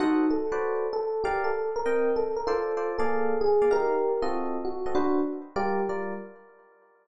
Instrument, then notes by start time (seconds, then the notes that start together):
electric piano 1
0.00 D#4 F#4 A4 C5 D#5 F#5
0.30 A4
0.52 F#4 B4 C5 D5
0.93 A4
1.24 G4 A#4 D5 F5
1.44 A4
1.76 A#4
1.86 C4 A#4 D#5 G5
2.16 A4
2.36 A#4
2.47 F4 A4 C5 D5
2.77 F4 A4 C5 D5
2.98 A#3 G#4 A4 D5 F5
3.41 G#4
3.62 A#3 G#4 D5 F5
3.71 D#4 G4 A#4 F5
4.22 C4 F4 F#4 A4 D#5
4.65 F#4
4.86 C4 F#4 A4 D#5
4.95 D4 F#4 B4 C5
5.56 G3 F4 G4 A#4 D5
5.89 G3 F4 A#4 D5